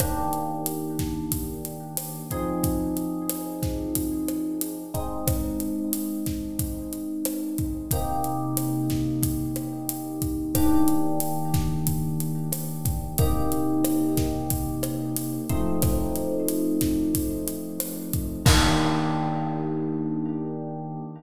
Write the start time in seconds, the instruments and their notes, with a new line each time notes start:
0.00 electric piano 1 D#3 A#3 D4 G4, kick, cross-stick, closed hi-hat
0.33 closed hi-hat
0.66 closed hi-hat
0.99 kick, snare, closed hi-hat
1.32 kick, closed hi-hat
1.65 closed hi-hat
1.97 cross-stick, closed hi-hat
2.31 electric piano 1 F3 C4 D#4 G#4, kick, closed hi-hat
2.64 kick, closed hi-hat
2.97 closed hi-hat
3.30 cross-stick, closed hi-hat
3.63 kick, snare, closed hi-hat
3.95 kick, closed hi-hat
4.28 cross-stick, closed hi-hat
4.61 closed hi-hat
4.94 electric piano 1 G#3 C4 D#4, kick, closed hi-hat
5.27 kick, cross-stick, closed hi-hat
5.60 closed hi-hat
5.93 closed hi-hat
6.26 kick, snare, closed hi-hat
6.59 kick, closed hi-hat
6.93 closed hi-hat
7.25 cross-stick, closed hi-hat
7.58 kick, closed hi-hat
7.91 electric piano 1 C3 A#3 D#4 G4, kick, closed hi-hat
8.24 closed hi-hat
8.57 cross-stick, closed hi-hat
8.90 kick, snare, closed hi-hat
9.23 kick, closed hi-hat
9.56 cross-stick, closed hi-hat
9.89 closed hi-hat
10.22 kick, closed hi-hat
10.55 electric piano 1 D#3 A#3 D4 G4, kick, cross-stick, closed hi-hat
10.88 closed hi-hat
11.20 closed hi-hat
11.54 kick, snare, closed hi-hat
11.87 kick, closed hi-hat
12.20 closed hi-hat
12.52 cross-stick, closed hi-hat
12.85 kick, closed hi-hat
13.18 electric piano 1 C3 A#3 D#4 G4, kick, closed hi-hat
13.52 closed hi-hat
13.84 cross-stick, closed hi-hat
14.17 kick, snare, closed hi-hat
14.50 kick, closed hi-hat
14.83 cross-stick, closed hi-hat
15.16 closed hi-hat
15.49 electric piano 1 F3 A3 C4 D#4, kick, closed hi-hat
15.82 kick, cross-stick, closed hi-hat
16.16 closed hi-hat
16.48 closed hi-hat
16.81 kick, snare, closed hi-hat
17.15 kick, closed hi-hat
17.48 closed hi-hat
17.80 cross-stick, closed hi-hat
18.13 kick, closed hi-hat
18.45 electric piano 1 D#3 A#3 D4 G4, kick, crash